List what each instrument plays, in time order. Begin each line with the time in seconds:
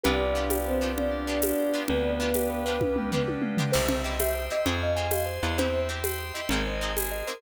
0.04 electric bass (finger) C2, orchestral harp B3 D4 F4 G4, drawbar organ B3 D4 F4 G4, choir aahs D4, vibraphone G4 B4, tubular bells B4, low conga
0.20 tubular bells D5
0.34 orchestral harp B3 D4 F4 G4, tubular bells F5
0.50 tubular bells G5, tambourine, high conga
0.66 choir aahs C4, tubular bells B4
0.81 orchestral harp B3 D4 F4 G4, tubular bells D5
0.97 choir aahs D4, tubular bells F5, low conga
1.11 tubular bells G5
1.27 orchestral harp B3 D4 F4 G4, tubular bells B4
1.42 choir aahs D4, tubular bells D5, tambourine, high conga
1.59 tubular bells F5
1.73 orchestral harp B3 D4 F4 G4, tubular bells G5
1.88 electric bass (finger) D2, choir aahs B3, drawbar organ B3 D4 G4 B4, tubular bells B4, vibraphone B4 D5, low conga
2.05 tubular bells D5
2.20 orchestral harp B3 D4 F4 G4, tubular bells F5
2.34 tubular bells G5, tambourine, high conga
2.50 tubular bells B4
2.66 orchestral harp B3 D4 F4 G4, vibraphone C5, tubular bells D5
2.81 vibraphone B4, tubular bells F5, kick, high tom
2.96 tubular bells G5, mid tom
3.11 orchestral harp B3 D4 F4 G4, tubular bells B4, floor tom
3.28 tubular bells D5, high tom
3.42 tubular bells F5, mid tom
3.57 orchestral harp B3 D4 F4 G4, tubular bells G5, floor tom
3.72 electric bass (finger) C2, orchestral harp C4 E4 G4, vibraphone C5, tubular bells C5, drawbar organ C5 E5 G5, crash
3.88 tubular bells E5, low conga
4.04 orchestral harp C4 E4 G4, vibraphone D#5, tubular bells G5
4.20 drawbar organ C5 G5 C6, tubular bells E5, vibraphone E5, tambourine, high conga
4.35 tubular bells C5
4.50 orchestral harp C4 E4 G4, vibraphone D#5, tubular bells E5
4.65 electric bass (finger) F2, orchestral harp C4 F4 G#4, tubular bells C5, drawbar organ C5 F5 G#5, vibraphone C5, low conga
4.82 vibraphone D#5, tubular bells F5
4.96 orchestral harp C4 F4 G#4, tubular bells G#5
5.11 drawbar organ C5 G#5 C6, vibraphone D#5, tubular bells F5, tambourine, high conga
5.26 tubular bells C5
5.43 electric bass (finger) E2, orchestral harp C4 F4 G#4, vibraphone D#5, tubular bells F5
5.58 orchestral harp C4 E4 G4, tubular bells C5, drawbar organ C5 E5 G5, vibraphone C5, low conga
5.74 tubular bells E5
5.89 orchestral harp C4 E4 G4, tubular bells G5
6.04 drawbar organ C5 G5 C6, tubular bells E5, tambourine, high conga
6.19 tubular bells C5
6.34 orchestral harp C4 E4 G4, vibraphone D#5, tubular bells E5
6.49 electric bass (finger) G#1, orchestral harp A#3 C4 D#4 G#4, drawbar organ A#4 C5 D#5 G#5, tubular bells A#4, low conga
6.67 tubular bells C5, vibraphone D#5
6.80 orchestral harp A#3 C4 D#4 G#4, tubular bells D#5
6.96 drawbar organ G#4 A#4 C5 G#5, vibraphone G#4, tubular bells G#5, tambourine, high conga
7.11 tubular bells D#5
7.27 orchestral harp A#3 C4 D#4 G#4, vibraphone A#4, tubular bells C5